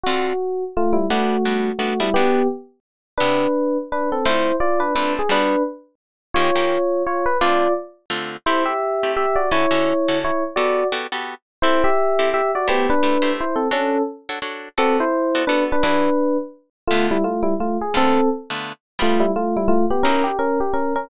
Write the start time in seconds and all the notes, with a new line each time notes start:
0.04 D3 C4 F4 F#4 A4
0.77 A3 F4
0.93 G3 E4
1.10 G3 A3 B3 D4 F#4
1.45 G3 B3 D4 F#4
1.79 G3 A3 B3 D4 F#4
2.00 G3 B3 D4 E4 F#4
2.14 G3 B3 D4 F#4 G4
3.18 C3 B3 D4 E4 G4 B4
3.92 D4 B4
4.12 C4 A4
4.25 D3 A3 C4 E4 F4 C5
4.60 F4 D5
4.80 D4 B4
4.95 D3 A3 C4 D4 F4 B4
5.19 G#4
5.29 G3 B3 D4 F#4 B4
6.34 D#3 A#3 C#4 F4 G4 C#5
6.56 D#3 A#3 C#4 G4
7.07 F4 C#5
7.26 B4
7.41 D3 A3 C4 F4 D5
8.10 D3 A3 C4 F4
8.46 A3 C4 E4 G4 C5
8.66 G4 E5
9.03 A3 C4 E4 G4
9.17 G4 E5
9.36 F#4 D5
9.51 D3 C#4 E4 F#4 A4 C#5
9.71 D3 C#4 F#4 A4
10.08 D3 C#4 F#4 A4
10.24 E4 C#5
10.56 B3 F#4 G4 A4 D5
10.92 B3 F#4 G4 A4
11.12 B3 F#4 G4 A4
11.62 C4 E4 G4 A4 C5
11.84 G4 E5
12.19 C4 E4 G4 A4
12.34 G4 E5
12.55 F#4 D5
12.68 A3 B3 E4 G4 C5
12.90 D4 B4
13.03 A3 E4 G4 C5
13.22 A3 E4 G4 C5
13.41 E4 C5
13.56 C4 A4
13.71 C#4 D4 F#4 A4 C#5
14.29 D4 F#4 A4 C#5
14.42 D4 F#4 A4 C#5
14.78 B3 C4 F#4 A4 D5
15.00 E4 C5
15.35 B3 F#4 A4 D5
15.47 B3 D4 F#4 A4 B4 D5
15.72 D4 B4
15.83 E3 D4 F#4 G#4 B4 D5
16.87 D3 A3 B3 F4
17.11 G3 E4
17.24 A3 F4
17.43 G3 E4
17.60 A3 F4
17.81 G#4
17.94 D3 A3 B3 C4 F4 A4
18.50 D3 A3 B3 F4
18.99 G3 A3 B3 D4 F4
19.20 G3 E4
19.36 A3 F4
19.57 G3 E4
19.68 A3 F4
19.90 B3 G4
20.03 F#3 A#3 C#4 D#4 E4 A#4
20.24 G4
20.39 C#4 A#4
20.60 G4
20.74 C#4 A#4
20.96 C#4 A#4